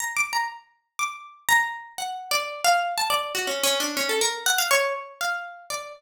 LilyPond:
\new Staff { \time 4/4 \tempo 4 = 121 \tuplet 3/2 { bes''8 d'''8 bes''8 } r4 d'''4 bes''4 | \tuplet 3/2 { ges''4 d''4 f''4 } a''16 d''8 ges'16 \tuplet 3/2 { des'8 des'8 d'8 } | des'16 a'16 bes'8 ges''16 f''16 des''8 r8 f''4 d''8 | }